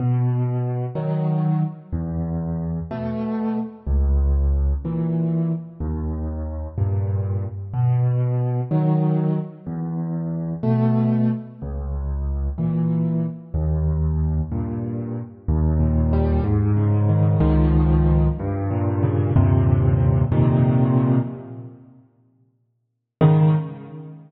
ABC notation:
X:1
M:6/8
L:1/8
Q:3/8=62
K:G#m
V:1 name="Acoustic Grand Piano"
B,,3 [D,F,]3 | E,,3 [B,,=A,]3 | C,,3 [A,,E,]3 | D,,3 [=G,,A,,]3 |
B,,3 [D,F,]3 | E,,3 [B,,=A,]3 | C,,3 [A,,E,]3 | D,,3 [=G,,A,,]3 |
[K:Ab] E,, B,, G, A,, D, E, | [D,,A,,E,F,]3 G,, B,, D, | [E,,G,,B,,C,]3 [F,,B,,C,E,]3 | z6 |
[A,,D,E,]3 z3 |]